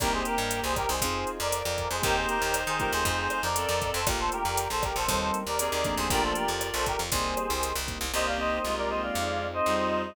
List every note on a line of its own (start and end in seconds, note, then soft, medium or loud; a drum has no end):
0.00 0.23 C2 medium
0.00 0.75 A#3 medium
0.00 0.37 A#3 medium
0.00 0.37 C4 medium
0.00 0.37 D#4 medium
0.00 0.12 G4 medium
0.00 0.75 G4 medium
0.00 0.37 G4 medium
0.00 0.12 A#4 medium
0.00 1.01 A#4 medium
0.00 1.01 C5 medium
0.00 1.01 D#5 medium
0.00 1.01 G5 medium
0.00 kick medium
0.00 cross-stick medium
0.00 closed hi-hat medium
0.13 0.25 G#4 medium
0.13 0.25 C5 medium
0.25 0.60 G4 medium
0.25 0.60 A#4 medium
0.25 closed hi-hat medium
0.38 0.61 G2 medium
0.51 closed hi-hat medium
0.64 0.86 C2 medium
0.64 0.76 G#4 medium
0.64 0.76 C5 medium
0.76 0.88 G4 medium
0.76 0.88 A#4 medium
0.76 kick medium
0.76 cross-stick medium
0.76 closed hi-hat medium
0.89 1.00 C2 medium
0.89 1.30 G#4 medium
0.89 1.30 C5 medium
1.01 1.25 F2 medium
1.01 1.39 C4 medium
1.01 1.39 D#4 medium
1.01 1.39 F4 medium
1.01 1.39 G#4 medium
1.01 2.03 C5 medium
1.01 2.03 D#5 medium
1.01 2.03 F5 medium
1.01 2.03 G#5 medium
1.01 kick medium
1.01 closed hi-hat medium
1.27 closed hi-hat medium
1.40 1.63 F2 medium
1.40 1.88 A#4 medium
1.40 1.88 D5 medium
1.52 cross-stick medium
1.52 closed hi-hat medium
1.65 1.88 F2 medium
1.78 kick medium
1.78 closed hi-hat medium
1.91 2.02 F2 medium
1.91 2.03 G#4 medium
1.91 2.03 C5 medium
2.02 2.26 D#2 medium
2.02 2.38 A#3 medium
2.02 2.38 C4 medium
2.02 2.38 D#4 medium
2.02 3.47 D#4 medium
2.02 2.38 G4 medium
2.02 2.16 G4 medium
2.02 3.04 A#4 medium
2.02 2.16 A#4 medium
2.02 3.04 C5 medium
2.02 3.47 C5 loud
2.02 3.04 D#5 medium
2.02 3.04 G5 medium
2.02 kick medium
2.02 closed hi-hat medium
2.16 2.28 G#4 medium
2.16 2.28 C5 medium
2.29 2.60 G4 medium
2.29 2.60 A#4 medium
2.29 closed hi-hat medium
2.42 2.65 D#2 medium
2.54 cross-stick medium
2.54 closed hi-hat medium
2.67 2.90 D#3 medium
2.67 2.79 G#4 medium
2.67 2.79 C5 medium
2.79 3.41 A3 medium
2.79 3.41 C4 medium
2.79 3.41 D#4 medium
2.79 3.41 F4 medium
2.79 2.92 G4 medium
2.79 2.92 A#4 medium
2.79 kick medium
2.79 closed hi-hat medium
2.92 3.04 D#2 medium
2.92 3.42 G#4 medium
2.92 3.42 C5 medium
3.05 3.28 F2 medium
3.05 4.06 A4 medium
3.05 4.06 C5 medium
3.05 4.06 D#5 medium
3.05 4.06 F5 medium
3.05 kick medium
3.05 closed hi-hat medium
3.30 cross-stick medium
3.30 closed hi-hat medium
3.43 3.66 F2 medium
3.43 3.89 A#4 medium
3.43 3.89 D5 medium
3.56 4.00 C4 medium
3.56 4.00 A4 medium
3.56 closed hi-hat medium
3.69 3.92 F2 medium
3.82 kick medium
3.82 closed hi-hat medium
3.94 4.06 F2 medium
3.94 4.06 A4 medium
3.94 4.06 C5 medium
4.07 4.30 A#1 medium
4.07 4.43 A3 medium
4.07 4.43 A#3 medium
4.07 4.43 D4 medium
4.07 4.43 F4 loud
4.07 4.19 G4 medium
4.07 5.08 A4 medium
4.07 4.19 A#4 medium
4.07 5.08 A#4 medium
4.07 5.08 D5 medium
4.07 5.08 F5 medium
4.07 kick medium
4.07 cross-stick medium
4.07 closed hi-hat medium
4.19 4.32 A4 medium
4.19 4.32 C5 medium
4.32 4.67 G4 medium
4.32 4.67 A#4 medium
4.32 closed hi-hat medium
4.45 4.68 F2 medium
4.57 closed hi-hat medium
4.70 4.93 A#1 medium
4.70 4.83 A4 medium
4.70 4.83 C5 medium
4.83 4.95 G4 medium
4.83 4.95 A#4 medium
4.83 kick medium
4.83 cross-stick medium
4.83 closed hi-hat medium
4.96 5.07 A#1 medium
4.96 5.38 A4 medium
4.96 5.38 C5 medium
5.08 5.31 D#2 medium
5.08 5.43 G3 medium
5.08 5.43 A#3 medium
5.08 5.43 C4 medium
5.08 5.43 D#4 medium
5.08 6.09 G4 medium
5.08 6.09 A#4 medium
5.08 6.09 C5 medium
5.08 6.09 D#5 medium
5.08 kick medium
5.08 closed hi-hat medium
5.34 closed hi-hat medium
5.47 5.69 D#2 medium
5.47 5.95 A#4 medium
5.47 5.95 D5 medium
5.59 6.07 C4 medium
5.59 6.07 G#4 medium
5.59 cross-stick medium
5.59 closed hi-hat loud
5.72 5.95 D#2 medium
5.84 6.46 F3 medium
5.84 6.46 A3 medium
5.84 6.46 A#3 medium
5.84 6.46 D4 medium
5.84 kick medium
5.84 closed hi-hat medium
5.97 6.09 D#2 medium
5.97 6.10 G#4 medium
5.97 6.10 C5 medium
6.10 6.33 A#1 medium
6.10 7.11 F4 medium
6.10 6.85 F4 medium
6.10 6.22 G4 medium
6.10 7.11 A4 medium
6.10 7.11 A#4 medium
6.10 6.22 A#4 medium
6.10 7.11 D5 medium
6.10 6.85 D5 medium
6.10 kick medium
6.10 closed hi-hat medium
6.23 6.35 A4 medium
6.23 6.35 C5 medium
6.35 6.67 G4 medium
6.35 6.67 A#4 medium
6.35 closed hi-hat medium
6.48 6.71 F2 medium
6.61 cross-stick medium
6.61 closed hi-hat medium
6.74 6.97 A#1 medium
6.74 6.86 A4 medium
6.74 6.86 C5 medium
6.86 6.99 G4 medium
6.86 6.99 A#4 medium
6.86 kick medium
6.86 closed hi-hat medium
6.99 7.11 F2 medium
7.12 7.35 C2 medium
7.12 7.48 G3 medium
7.12 7.48 A#3 medium
7.12 7.48 C4 medium
7.12 7.48 D#4 medium
7.12 8.13 G4 medium
7.12 7.73 G#4 medium
7.12 8.13 A#4 medium
7.12 7.73 C5 medium
7.12 8.13 C5 medium
7.12 8.13 D#5 medium
7.12 kick medium
7.12 closed hi-hat medium
7.37 cross-stick medium
7.37 closed hi-hat medium
7.50 7.73 C2 medium
7.63 closed hi-hat medium
7.76 7.98 C2 medium
7.88 8.05 G3 medium
7.88 8.05 A#3 medium
7.88 8.05 C4 medium
7.88 8.05 D#4 medium
7.88 kick medium
7.88 closed hi-hat medium
8.01 8.12 C2 medium
8.13 8.59 C2 medium
8.13 8.58 A#3 medium
8.13 9.14 A#3 medium
8.13 9.10 A#3 loud
8.13 9.14 C4 medium
8.13 9.14 D#4 medium
8.13 8.58 G4 loud
8.13 9.14 G4 medium
8.13 8.26 C5 medium
8.13 8.26 D#5 medium
8.26 8.38 D5 medium
8.26 8.38 F5 medium
8.38 9.10 C4 medium
8.38 8.76 C5 medium
8.38 8.76 D#5 medium
8.63 9.10 C2 medium
8.63 9.46 G#3 medium
8.63 9.11 D#4 medium
8.63 9.46 F4 medium
8.77 8.89 A#4 medium
8.77 8.89 D5 medium
8.89 9.14 G4 medium
8.89 9.02 C5 medium
8.89 9.02 D#5 medium
9.02 9.47 D5 medium
9.02 9.47 F5 medium
9.15 9.61 F2 medium
9.15 10.11 C4 loud
9.15 10.15 C4 medium
9.15 10.15 D#4 medium
9.15 10.15 F4 medium
9.15 10.15 G#4 medium
9.40 10.13 D#4 medium
9.53 10.01 C5 medium
9.53 10.01 D#5 medium
9.66 10.12 F2 medium
9.66 10.14 G3 medium
9.66 10.14 D#4 medium
9.66 10.15 F4 medium
9.92 10.15 G#4 medium
10.04 10.15 C5 medium
10.04 10.15 D#5 medium